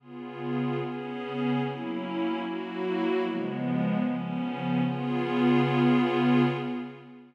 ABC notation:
X:1
M:4/4
L:1/8
Q:1/4=149
K:Db
V:1 name="Pad 5 (bowed)"
[D,_CFA]4 [D,CDA]4 | [G,B,D_F]4 [G,B,FG]4 | [D,F,A,_C]4 [D,F,CD]4 | [D,_CFA]8 |]